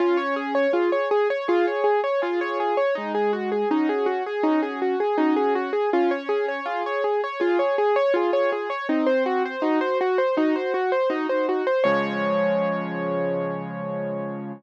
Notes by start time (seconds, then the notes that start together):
0.00 C#4 F4
0.17 C#5
0.36 G#4
0.55 C#5
0.73 F4 G#4
0.92 C#5
1.11 G#4
1.30 C#5
1.48 F4 G#4
1.67 C#5
1.84 G#4
2.04 C#5
2.22 F4 G#4
2.41 C#5
2.60 G#4
2.77 C#5
2.95 G#3 D#4
3.15 G#4
3.33 F#4
3.52 G#4
3.71 C#4 D#4 F#4
3.89 G#4
4.06 F#4
4.26 G#4
4.43 C#4 D#4 F#4
4.63 G#4
4.82 F#4
5.00 G#4
5.18 C#4 D#4 F#4
5.36 G#4
5.55 F#4
5.73 G#4
5.93 C#4 F4
6.11 C#5
6.29 G#4
6.48 C#5
6.66 F4 G#4
6.86 C#5
7.04 G#4
7.24 C#5
7.40 F4 G#4
7.59 C#5
7.78 G#4
7.96 C#5
8.14 F4 G#4
8.33 C#5
8.52 G#4
8.70 C#5
8.89 C4 D#4
9.06 C5
9.26 F#4
9.46 C5
9.62 D#4 F#4
9.81 C5
10.01 F#4
10.18 C5
10.37 D#4 F#4
10.56 C5
10.74 F#4
10.92 C5
11.10 D#4 F#4
11.29 C5
11.49 F#4
11.67 C5
11.84 C#3 F3 G#3 C#5